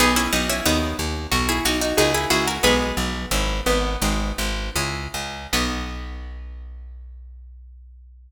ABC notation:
X:1
M:4/4
L:1/16
Q:1/4=91
K:B
V:1 name="Harpsichord"
[B,D] [CE] [B,D] [CE] [B,D]2 z3 [EG] [DF] [DF] [DF] [EG] [EG] [FA] | "^rit." [GB]8 z8 | B16 |]
V:2 name="Harpsichord"
[GB]8 F4 G z F2 | "^rit." [G,B,]6 B,4 z6 | B,16 |]
V:3 name="Orchestral Harp"
[B,DF]4 [A,DF]4 [B,DF]4 [A,CE]4 | "^rit." [B,DF]4 [CEG]4 [^B,DFG]4 [CEG]4 | [B,DF]16 |]
V:4 name="Electric Bass (finger)" clef=bass
B,,,2 B,,,2 D,,2 D,,2 B,,,2 B,,,2 C,,2 C,,2 | "^rit." B,,,2 B,,,2 G,,,2 G,,,2 G,,,2 G,,,2 C,,2 C,,2 | B,,,16 |]